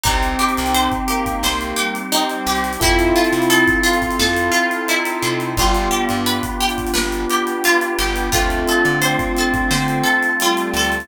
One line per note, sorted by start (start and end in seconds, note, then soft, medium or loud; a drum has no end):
0.03 0.36 C2 loud
0.03 2.75 C4 medium
0.03 1.42 C4 medium
0.03 0.91 C4 medium
0.03 0.35 D#4 medium
0.03 2.75 D#4 loud
0.03 1.42 D#4 medium
0.03 2.75 G4 medium
0.03 1.42 G4 medium
0.03 kick loud
0.03 closed hi-hat medium
0.23 closed hi-hat medium
0.39 0.71 G4 medium
0.39 closed hi-hat medium
0.49 closed hi-hat medium
0.57 0.89 C2 loud
0.57 closed hi-hat medium
0.66 closed hi-hat medium
0.74 1.06 C5 medium
0.74 closed hi-hat loud
0.92 kick medium
0.92 closed hi-hat medium
1.08 1.97 A#3 medium
1.08 1.40 G4 medium
1.08 closed hi-hat medium
1.26 kick medium
1.26 closed hi-hat medium
1.43 1.74 C2 medium
1.43 2.81 G3 medium
1.43 2.81 C4 medium
1.43 2.81 G4 medium
1.43 1.76 C5 medium
1.43 snare loud
1.61 closed hi-hat medium
1.76 2.08 G4 medium
1.76 closed hi-hat medium
1.95 closed hi-hat medium
2.12 2.69 C4 medium
2.12 2.44 D#4 medium
2.12 closed hi-hat loud
2.29 closed hi-hat medium
2.46 2.77 C2 medium
2.46 2.79 G4 medium
2.46 closed hi-hat medium
2.55 closed hi-hat medium
2.64 closed hi-hat medium
2.73 closed hi-hat medium
2.80 3.13 F2 loud
2.80 5.50 C4 loud
2.80 4.18 C4 medium
2.80 5.50 E4 loud
2.80 3.65 E4 medium
2.80 4.18 E4 medium
2.80 3.14 E4 medium
2.80 5.50 F4 loud
2.80 4.18 F4 medium
2.80 5.50 A4 loud
2.80 4.18 A4 medium
2.80 kick loud
2.80 closed hi-hat loud
2.99 closed hi-hat medium
3.16 3.47 F4 soft
3.16 closed hi-hat medium
3.24 closed hi-hat medium
3.32 3.63 C3 medium
3.32 closed hi-hat medium
3.42 closed hi-hat medium
3.50 3.82 A4 medium
3.50 closed hi-hat loud
3.68 kick medium
3.68 closed hi-hat medium
3.83 4.15 F4 medium
3.83 4.86 F4 medium
3.83 closed hi-hat medium
3.93 closed hi-hat medium
4.02 kick medium
4.02 closed hi-hat medium
4.11 closed hi-hat medium
4.19 4.50 F2 medium
4.19 5.57 C4 medium
4.19 5.57 E4 medium
4.19 4.51 A4 medium
4.19 5.57 A4 medium
4.19 5.57 C5 medium
4.19 snare loud
4.36 closed hi-hat medium
4.52 4.83 F4 medium
4.52 closed hi-hat medium
4.71 closed hi-hat medium
4.87 5.54 D#4 medium
4.87 5.21 E4 medium
4.87 closed hi-hat medium
5.05 closed hi-hat medium
5.22 5.54 C3 medium
5.22 5.54 F4 medium
5.22 closed hi-hat medium
5.40 closed hi-hat medium
5.57 5.88 G1 loud
5.57 6.16 G3 loud
5.57 6.93 B3 medium
5.57 8.28 B3 loud
5.57 6.93 D4 medium
5.57 8.28 D4 loud
5.57 6.93 F4 medium
5.57 8.28 F4 loud
5.57 5.91 F4 medium
5.57 6.93 G4 medium
5.57 8.28 G4 loud
5.57 kick loud
5.57 closed hi-hat medium
5.75 closed hi-hat medium
5.91 6.23 G4 medium
5.91 closed hi-hat medium
6.09 6.41 G2 medium
6.09 closed hi-hat medium
6.26 6.58 B4 medium
6.26 closed hi-hat loud
6.43 kick medium
6.43 closed hi-hat medium
6.60 6.92 G4 medium
6.60 closed hi-hat medium
6.69 closed hi-hat medium
6.78 kick medium
6.78 closed hi-hat medium
6.87 closed hi-hat medium
6.94 7.26 G1 medium
6.94 8.32 B3 medium
6.94 8.32 D4 medium
6.94 8.32 G4 medium
6.94 7.25 B4 medium
6.94 8.32 B4 medium
6.94 snare loud
7.12 closed hi-hat medium
7.30 7.62 G4 medium
7.30 closed hi-hat medium
7.47 closed hi-hat medium
7.64 7.97 F4 medium
7.64 closed hi-hat loud
7.81 closed hi-hat medium
7.99 8.30 G1 medium
7.99 8.30 G4 medium
7.99 closed hi-hat medium
8.16 closed hi-hat medium
8.32 8.65 D2 loud
8.32 11.04 A3 loud
8.32 8.90 A3 medium
8.32 9.71 A3 medium
8.32 11.04 C4 loud
8.32 9.71 C4 medium
8.32 11.04 D4 loud
8.32 9.71 D4 medium
8.32 8.64 F4 medium
8.32 11.04 F4 medium
8.32 9.71 F4 medium
8.32 kick loud
8.32 closed hi-hat loud
8.50 closed hi-hat medium
8.68 9.00 A4 medium
8.68 closed hi-hat medium
8.85 9.16 D3 loud
8.85 closed hi-hat medium
9.02 10.27 C4 medium
9.02 9.33 C5 medium
9.02 closed hi-hat loud
9.19 kick medium
9.19 closed hi-hat medium
9.37 9.70 A4 medium
9.37 closed hi-hat medium
9.54 kick medium
9.54 closed hi-hat medium
9.71 10.02 D3 loud
9.71 11.08 A3 medium
9.71 11.08 C4 medium
9.71 11.08 F4 medium
9.71 11.08 A4 medium
9.71 10.02 C5 medium
9.71 snare loud
9.88 closed hi-hat medium
10.03 10.35 A4 medium
10.03 closed hi-hat medium
10.23 closed hi-hat medium
10.40 10.99 G3 medium
10.40 10.74 F4 medium
10.40 closed hi-hat loud
10.57 closed hi-hat medium
10.74 11.05 D2 medium
10.74 11.08 A4 medium
10.74 closed hi-hat medium
10.83 closed hi-hat medium
10.92 closed hi-hat medium
11.00 closed hi-hat medium